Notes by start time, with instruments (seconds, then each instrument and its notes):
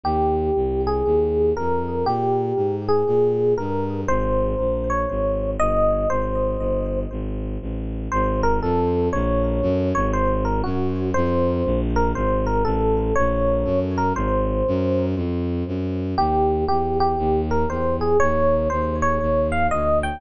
0.04 violin D#2, electric piano 1 G4
0.56 violin C2
0.87 electric piano 1 G#4
1.06 violin D#2
1.57 violin F2, electric piano 1 A#4
2.06 violin A#2, electric piano 1 G4
2.56 violin G#2
2.89 electric piano 1 G#4
3.07 violin A#2
3.58 violin G2, electric piano 1 A#4
4.08 violin G#1, electric piano 1 C5
4.59 violin A#1
4.90 electric piano 1 C#5
5.10 violin G#1
5.59 violin G1, electric piano 1 D#5
6.10 violin G#1, electric piano 1 C5
6.59 violin G1
7.11 violin G#1
7.61 violin A1
8.12 violin G#1, electric piano 1 C5
8.43 electric piano 1 A#4
8.62 violin F2, electric piano 1 A4
9.13 violin A#1, electric piano 1 C#5
9.62 violin F#2
9.95 violin G#1, electric piano 1 C#5
10.13 electric piano 1 C5
10.45 electric piano 1 A#4
10.64 violin F#2, electric piano 1 F#4
11.14 violin F2, electric piano 1 C5
11.65 violin A#1
11.96 electric piano 1 A#4
12.15 violin G#1, electric piano 1 C5
12.47 electric piano 1 A#4
12.65 violin A1, electric piano 1 A4
13.16 violin A#1, electric piano 1 C#5
13.65 violin F#2
13.98 electric piano 1 A#4
14.15 violin G#1, electric piano 1 C5
14.68 violin F#2
15.16 violin F2
15.67 violin F#2
16.18 violin D#2, electric piano 1 G4
16.68 violin E2, electric piano 1 G4
17.00 electric piano 1 G4
17.18 violin D#2
17.51 electric piano 1 A#4
17.69 violin E2, electric piano 1 C5
18.01 electric piano 1 G#4
18.20 violin D#2, electric piano 1 C#5
18.70 violin D#2, electric piano 1 C5
19.02 electric piano 1 C#5
19.21 violin D#2
19.52 electric piano 1 F5
19.71 violin D2, electric piano 1 D#5
20.03 electric piano 1 G5